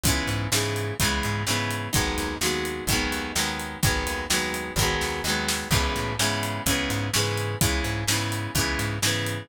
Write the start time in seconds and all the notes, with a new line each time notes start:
0.04 C#2 C#3 E3, kick, closed hi-hat
0.08 G#3 B3
0.27 G#2, closed hi-hat
0.52 G#2 C#3 E3 G#3, snare
0.56 B3
0.76 closed hi-hat
1.00 C#2 C#3 E3 G#3, kick, closed hi-hat
1.05 B3
1.23 G#2, closed hi-hat
1.47 G#2 C#3 E3 G#3 B3, snare
1.71 closed hi-hat
1.93 G#1 D#3 F#3 G#3, kick, closed hi-hat
1.97 B3
2.18 D#2, closed hi-hat
2.41 D#2 D#3 F#3 G#3, snare
2.46 B3
2.65 closed hi-hat
2.87 G#1 D#3 F#3, kick, closed hi-hat
2.92 G#3 B3
3.12 D#2, closed hi-hat
3.35 D#2 D#3 F#3 G#3, snare
3.39 B3
3.60 closed hi-hat
3.83 G#1 D#3 F#3 G#3, kick, closed hi-hat
3.87 B3
4.07 D#2, closed hi-hat
4.30 D#2 D#3 F#3 G#3, snare
4.34 B3
4.54 closed hi-hat
4.76 G#1 D#3, kick, snare
4.80 F#3 G#3 B3
5.01 D#2, snare
5.24 D#2 D#3 F#3, snare
5.28 G#3 B3
5.49 snare
5.71 C#2 C#3 E3 G#3, kick, crash
5.75 B3
5.96 A2, closed hi-hat
6.19 G#2 C#3 E3 G#3, snare
6.24 B3
6.43 closed hi-hat
6.66 C#2 C#3 E3 G#3, kick, closed hi-hat
6.71 B3
6.90 G#2, closed hi-hat
7.13 G#2 C#3 E3 G#3, snare
7.18 B3
7.38 closed hi-hat
7.61 C#2 C#3 E3 G#3, kick, closed hi-hat
7.65 B3
7.84 G#2, closed hi-hat
8.08 G#2 C#3 E3, snare
8.12 G#3 B3
8.32 closed hi-hat
8.55 C#2 C#3 E3 G#3, kick, closed hi-hat
8.59 B3
8.79 G#2, closed hi-hat
9.02 G#2 C#3 E3 G#3, snare
9.07 B3
9.26 closed hi-hat